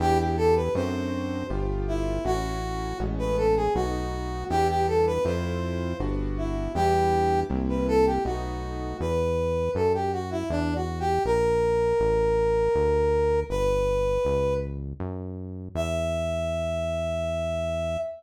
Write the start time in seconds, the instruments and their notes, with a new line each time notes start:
0.00 synth bass 1 E2, acoustic grand piano B3 D4 E4 G4, brass section G4
0.19 brass section G4
0.37 brass section A4
0.56 brass section B4
0.75 synth bass 1 F#2, acoustic grand piano A3 C4 D4 F#4, brass section C5
1.50 synth bass 1 G1, acoustic grand piano A3 B3 F4 G4
1.88 brass section E4
2.25 synth bass 1 A1, acoustic grand piano A3 C#4 E4 F#4, brass section F#4
3.00 synth bass 1 A1, acoustic grand piano G#3 A3 B3 C#4
3.19 brass section B4
3.37 brass section A4
3.56 brass section G#4
3.75 synth bass 1 B1, acoustic grand piano F#3 A3 B3 D#4, brass section F#4
4.50 synth bass 1 E2, acoustic grand piano G3 B3 D4 E4, brass section G4
4.69 brass section G4
4.88 brass section A4
5.07 brass section B4
5.25 synth bass 1 F2, acoustic grand piano A3 C4 E4 F4, brass section C5
6.00 synth bass 1 G1, acoustic grand piano G3 B3 D4 F#4
6.38 brass section E4
6.75 synth bass 1 E2, acoustic grand piano G3 B3 D4 E4, brass section G4
7.50 synth bass 1 C2, acoustic grand piano G3 A#3 C4 E4
7.69 brass section B4
7.88 brass section A4
8.06 brass section G4
8.25 synth bass 1 B1, acoustic grand piano F#3 A3 B3 D#4, brass section F#4
9.00 synth bass 1 E2, brass section B4
9.75 synth bass 1 F#2, brass section A4
9.94 brass section G4
10.12 brass section F#4
10.31 brass section E4
10.50 synth bass 1 E2, brass section D4
10.75 brass section F#4
11.00 brass section G4
11.25 synth bass 1 A#1, brass section A#4
12.00 synth bass 1 A1
12.75 synth bass 1 D2
13.50 synth bass 1 G1, brass section B4
14.25 synth bass 1 C#2
15.00 synth bass 1 F#2
15.75 synth bass 1 E2, brass section E5